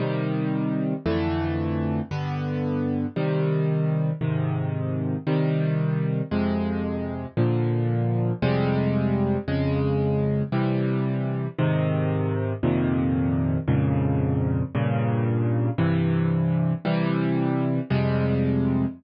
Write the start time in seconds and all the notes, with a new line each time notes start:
0.00 C3 D#3 G3
1.06 F2 D3 E3 A3
2.11 G2 D3 B3
3.16 C3 D#3 G3
4.21 G#2 C3 D#3
5.27 C3 D#3 G3
6.31 F2 C3 G#3
7.37 A#2 D3 F3
8.42 F2 C3 G3 G#3
9.48 F2 C#3 G#3
10.52 C3 E3 G3
11.58 G#2 C3 D#3
12.63 F2 A#2 C3 D#3
13.68 F2 G#2 A#2 C#3
14.75 G2 A#2 C#3
15.78 G2 C3 E3
16.85 C3 E3 G3
17.90 F2 C3 G3 G#3